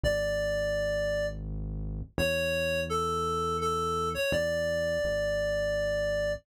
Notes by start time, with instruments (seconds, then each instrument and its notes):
0.03 synth bass 1 G#1, clarinet D5
2.18 synth bass 1 E2, clarinet C#5
2.89 clarinet A4
3.61 clarinet A4
4.14 clarinet C#5
4.32 synth bass 1 E2, clarinet D5
5.04 synth bass 1 G#1